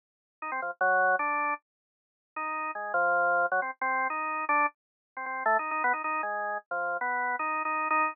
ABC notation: X:1
M:6/4
L:1/16
Q:1/4=155
K:none
V:1 name="Drawbar Organ"
z4 ^D C F, z ^F,4 | D4 z8 ^D4 ^G,2 F,6 | ^F, C z C3 ^D4 =D2 z5 C C2 (3A,2 ^D2 D2 | B, ^D D2 ^G,4 z F,3 B,4 (3D4 D4 D4 |]